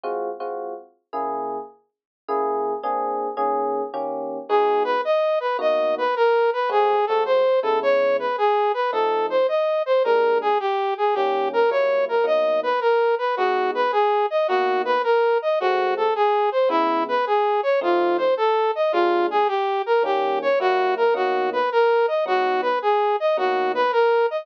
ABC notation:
X:1
M:4/4
L:1/8
Q:"Swing" 1/4=108
K:G#m
V:1 name="Brass Section"
z8 | z8 | G B d B d B A B | G =A ^B A c =B G B |
=A ^B d B ^A G =G ^G | =G A c A d B A B | F B G d F B A d | F =A G ^B E =B G c |
^E ^B =A d E G =G ^A | =G c F A F B A d | F B G d F B A d |]
V:2 name="Electric Piano 1"
[G,^B,^EF] [G,B,EF]3 [C,A,=EG]4 | [C,A,EG]2 [A,^B,=DG]2 [^D,A,CG]2 [D,A,C=G]2 | [G,B,DF]4 [B,,A,DF]4 | [G,=A,^B,F] [G,A,B,F]2 [C,G,=B,E]5 |
[^E,=A,^B,D]4 [^A,,=G,^G,=D]4 | [D,=G,A,C]2 [F,G,A,E]2 [B,,F,A,D]4 | [G,B,DF]4 [B,,A,DF]4 | [G,=A,^B,F]4 [C,G,=B,E]4 |
[^E,=A,^B,D]4 [^A,,=G,^G,=D]4 | [D,=G,A,C]2 [F,G,A,E]2 [B,,F,A,D]4 | [G,,F,B,D]4 [B,,F,A,D]4 |]